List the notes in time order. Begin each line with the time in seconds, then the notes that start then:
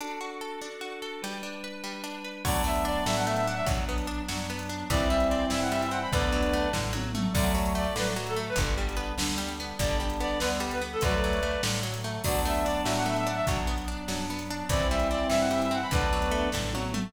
0.01 D4 F#4 A4
0.21 F#4
0.41 A4
0.61 D4
0.81 F#4
1.02 A4
1.22 G3 D4 B4
1.43 D4
1.64 B4
1.84 G3
2.04 D4
2.24 B4
2.44 D2 F#3 A3 B3 D4 D5, kick, crash
2.64 A3 E5
2.76 closed hi-hat
2.85 D4 D5
3.06 A2 F#3 E5, snare
3.17 F#5
3.26 A3 E5
3.36 E5, closed hi-hat
3.47 D4 F#5
3.56 E5
3.66 B1 F#3 B3 D4, kick, closed hi-hat
3.89 B3
3.98 closed hi-hat
4.07 D4
4.28 F#2 F#3 D4, snare
4.50 B3
4.59 closed hi-hat
4.69 D4
4.90 C2 E3 G3 C4 E4 D5, kick, closed hi-hat
5.10 G3 E5
5.20 closed hi-hat
5.29 C4 D5
5.50 G2 E3 E5, snare
5.62 F#5
5.72 G3 E5
5.82 E5, closed hi-hat
5.91 C4 F#5
6.01 B5
6.12 D2 D3 F#3 A3 B3 D4 B4 D5, kick, closed hi-hat
6.32 F#3
6.43 closed hi-hat
6.53 A3
6.73 A2 D3, kick, snare
6.93 F#3, high tom
7.14 A3, mid tom
7.33 D2 D3 F#3 A3 D5, kick, crash
7.55 F#3
7.66 closed hi-hat
7.75 A3 D5
7.95 A2 D3 F#3 B4, snare
8.16 F#3
8.27 A4, closed hi-hat
8.36 A3
8.49 B4
8.56 G1 D3 G3 B3 D4, kick, closed hi-hat
8.78 G3
8.89 closed hi-hat
8.97 B3
9.18 D2 D3 D4, snare
9.38 G3
9.49 closed hi-hat
9.60 B3
9.79 G1 D3 G3 B3 D4 D5, kick, closed hi-hat
10.00 G3 D4
10.10 closed hi-hat
10.20 B3 D5
10.39 D2 D3 B3 B4, snare
10.60 G3
10.71 B4, closed hi-hat
10.81 B3
10.93 A4
11.01 D2 D3 F#3 A3 B4 D5, kick, closed hi-hat
11.24 F#3
11.33 closed hi-hat
11.43 A3
11.63 A2 D3, snare
11.83 F#3
11.94 closed hi-hat
12.04 A3
12.23 D2 F#3 A3 B3 D4 D5, kick, crash
12.45 A3 E5
12.55 closed hi-hat
12.64 D4 D5
12.84 A2 F#3 E5, snare
12.97 F#5
13.06 A3 E5
13.16 E5, closed hi-hat
13.27 D4 F#5
13.36 E5
13.46 B1 F#3 B3 D4, kick, closed hi-hat
13.67 B3
13.78 closed hi-hat
13.88 D4
14.08 F#2 F#3 D4, snare
14.30 B3
14.39 closed hi-hat
14.50 D4
14.69 C2 E3 G3 C4 E4 D5, kick, closed hi-hat
14.90 G3 E5
14.99 closed hi-hat
15.11 C4 D5
15.30 G2 E3 E5, snare
15.40 F#5
15.51 G3 E5
15.62 E5, closed hi-hat
15.71 C4 F#5
15.82 B5
15.91 D2 D3 F#3 A3 B3 D4 B4 D5, kick, closed hi-hat
16.13 F#3
16.22 closed hi-hat
16.31 A3
16.52 A2 D3, kick, snare
16.73 F#3, high tom
16.94 A3, mid tom